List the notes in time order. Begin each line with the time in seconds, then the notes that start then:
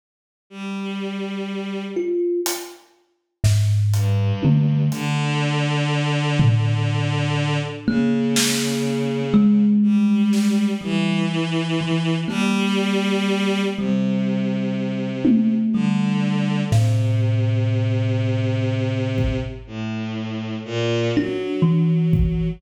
0.50 G3
1.97 F4
2.46 closed hi-hat
3.44 G#2, snare
3.94 G2, closed hi-hat
4.43 D3, high tom
4.91 D3, closed hi-hat
6.40 floor tom
7.87 C#3 A#3
8.36 snare
9.34 G#3
9.82 G3
10.33 snare
10.81 E3 G3
11.81 E3
12.28 G3 A#3, cowbell
13.76 C3 G3
15.25 high tom
15.73 D3 G3
16.71 A2 C3, snare
19.18 kick
19.67 A2
20.65 A#2
21.15 F#3 D4
21.62 E3
22.13 kick